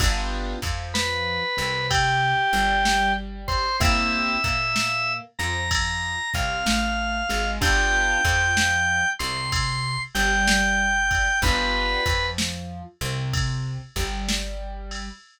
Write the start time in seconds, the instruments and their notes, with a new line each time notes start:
0.00 electric bass (finger) G1, acoustic grand piano B3 D4 F4 G4, kick, ride
0.62 electric bass (finger) F2, acoustic grand piano F3, kick, ride
0.94 drawbar organ B4, snare
1.57 electric bass (finger) C2, acoustic grand piano C3, ride
1.90 drawbar organ G4, kick, ride
2.53 electric bass (finger) G1, acoustic grand piano G3, ride
2.85 snare
3.48 drawbar organ C5, kick, ride
3.80 electric bass (finger) C2, acoustic grand piano A#3 C4 E4 G4, drawbar organ E5, kick, ride
4.44 electric bass (finger) A#2, acoustic grand piano A#3, kick, ride
4.76 snare
5.39 electric bass (finger) F2, acoustic grand piano F3, drawbar organ A#5, ride
5.71 kick, ride
6.34 electric bass (finger) C2, acoustic grand piano C3, drawbar organ F5, kick, ride
6.66 electric bass (finger) A1, acoustic grand piano A3, snare
7.29 electric bass (finger) G#1, acoustic grand piano G#3, ride
7.61 electric bass (finger) G1, acoustic grand piano B3 D4 F4 G4, drawbar organ G5, kick, ride
8.25 electric bass (finger) F2, acoustic grand piano F3, kick, ride
8.57 snare
9.19 electric bass (finger) C2, acoustic grand piano C3, drawbar organ C6, ride
9.52 kick, ride
10.15 electric bass (finger) G1, acoustic grand piano G3, drawbar organ G5, ride
10.47 snare
11.11 kick, ride
11.42 electric bass (finger) G1, acoustic grand piano B3 D4 F4 G4, drawbar organ B4, kick, ride
12.06 electric bass (finger) F2, acoustic grand piano F3, kick, ride
12.38 snare
13.01 electric bass (finger) C2, acoustic grand piano C3, ride
13.33 kick, ride
13.96 electric bass (finger) G1, acoustic grand piano G3, kick, ride
14.29 snare
14.91 ride